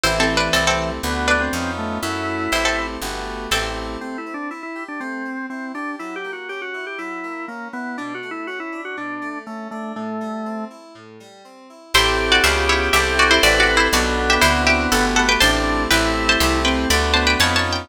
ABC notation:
X:1
M:4/4
L:1/16
Q:1/4=121
K:Ador
V:1 name="Pizzicato Strings"
(3[Ec]2 [CA]2 [DB]2 [CA] [CA]2 z3 [DB]6 | z4 [Ec] [CA]2 z5 [CA]4 | z16 | z16 |
z16 | z16 | [Ec]3 [Fd] [=Fe]2 [E_d]2 [Ge]2 [^F=d] [Ec] (3[Fd]2 [Fd]2 [Ec]2 | [Fd]3 [Ge] [Ec]2 [Ge]2 [Af]2 [Af] [Bg] [ca]4 |
[Bg]3 [ca] [ec']2 [Bg]2 [db]2 [ca] [Bg] (3[^ca]2 [ca]2 g2 |]
V:2 name="Drawbar Organ"
E,8 B,3 C3 A,2 | E8 z8 | (3C2 E2 D2 E E2 D C4 C2 D2 | (3E2 G2 F2 G F2 G E4 ^A,2 B,2 |
(3D2 F2 E2 F E2 F D4 A,2 A,2 | A,6 z10 | G12 B4 | B,12 D4 |
E6 C2 z2 B,4 z2 |]
V:3 name="Electric Piano 2"
[A,CEG]4 [A,CEG]4 [A,B,DF]4 [B,^C^D^E]4 | [A,^CEF]4 [A,=CEG]4 [A,B,FG]4 [A,CEG]4 | A,2 C2 E2 G2 A,2 C2 E2 G2 | F,2 ^A,2 ^C2 E2 F,2 A,2 C2 E2 |
B,,2 A,2 ^C2 D2 B,,2 A,2 C2 D2 | A,,2 G,2 C2 E2 A,,2 G,2 C2 E2 | [CEGA]4 [_C_D=F_A]4 [=CEG=A]4 [CEGA]4 | [B,DFA]4 [CDEF]4 [A,B,FG]4 [A,CEG]4 |
[A,CEG]4 [A,CEG]4 [A,B,DF]4 [B,^C^D^E]4 |]
V:4 name="Electric Bass (finger)" clef=bass
A,,,4 C,,4 D,,4 ^E,,4 | F,,4 A,,,4 G,,,4 A,,,4 | z16 | z16 |
z16 | z16 | A,,,4 _D,,4 C,,4 A,,,4 | B,,,4 D,,4 G,,,4 A,,,4 |
A,,,4 C,,4 D,,4 ^E,,4 |]